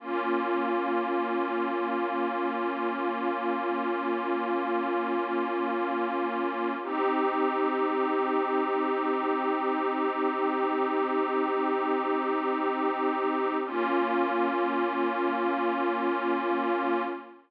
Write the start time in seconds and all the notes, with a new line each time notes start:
0.00 A#3 C#4 F4
6.82 C4 D#4 G4
13.65 A#3 C#4 F4